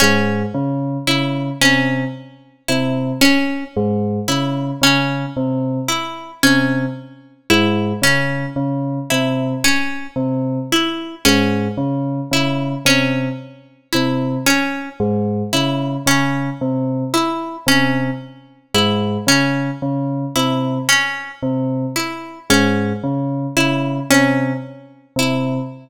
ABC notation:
X:1
M:6/8
L:1/8
Q:3/8=37
K:none
V:1 name="Tubular Bells" clef=bass
^G,, ^C, C, =C, z C, | z ^G,, ^C, C, =C, z | C, z ^G,, ^C, C, =C, | z C, z ^G,, ^C, C, |
C, z C, z ^G,, ^C, | ^C, =C, z C, z ^G,, | ^C, C, =C, z C, z | ^G,, ^C, C, =C, z C, |]
V:2 name="Pizzicato Strings"
^C z E C z E | ^C z E C z E | ^C z E C z E | ^C z E C z E |
^C z E C z E | ^C z E C z E | ^C z E C z E | ^C z E C z E |]